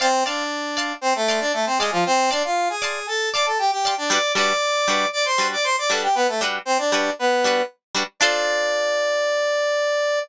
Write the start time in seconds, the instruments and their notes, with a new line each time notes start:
0.00 brass section C4 C5, acoustic guitar (steel) D5 F5 A5 C6
0.26 brass section D4 D5, acoustic guitar (steel) D5 F5 A5 C6
0.77 acoustic guitar (steel) D5 F5 A5 C6
1.01 brass section C4 C5
1.15 brass section A3 A4
1.28 acoustic guitar (steel) D5 F5 A5 C6
1.40 brass section D4 D5
1.53 brass section A3 A4
1.66 brass section C4 C5
1.78 brass section G#3 G#4, acoustic guitar (steel) D5 F5 A5
1.83 acoustic guitar (steel) C6
1.92 brass section F3 F4
2.06 brass section C4 C5
2.31 brass section D4 D5, acoustic guitar (steel) D5 F5 A5 C6
2.45 brass section F4 F5
2.70 brass section G#4 G#5
2.82 acoustic guitar (steel) D5 F5 A5 C6
3.07 brass section A4 A5
3.34 brass section D5 D6, acoustic guitar (steel) D5 F5 A5 C6
3.46 brass section A4 A5
3.59 brass section G4 G5
3.71 brass section G4 G5
3.85 acoustic guitar (steel) D5 F5 A5 C6
3.97 brass section D4 D5
4.10 acoustic guitar (steel) G3 D4 F#4 B4, brass section D5 D6
4.35 acoustic guitar (steel) G3 D4 F#4 B4, brass section D5 D6
4.88 acoustic guitar (steel) G3 D4 F#4 B4
5.13 brass section D5 D6
5.25 brass section C5 C6
5.38 acoustic guitar (steel) G3 D4 F#4 B4
5.53 brass section D5 D6
5.64 brass section C5 C6
5.78 brass section D5 D6
5.89 acoustic guitar (steel) G3 D4 F#4 B4, brass section A4 A5
6.03 brass section G4 G5
6.15 brass section B3 B4
6.28 brass section A3 A4
6.41 acoustic guitar (steel) G3 D4 F#4 B4
6.65 brass section C4 C5
6.78 brass section D4 D5
6.92 acoustic guitar (steel) G3 D4 F#4 B4
7.19 brass section B3 B4
7.44 acoustic guitar (steel) G3 D4 F#4 B4
7.95 acoustic guitar (steel) G3 D4 F#4 B4
8.20 acoustic guitar (steel) D4 F4 A4 C5, brass section D5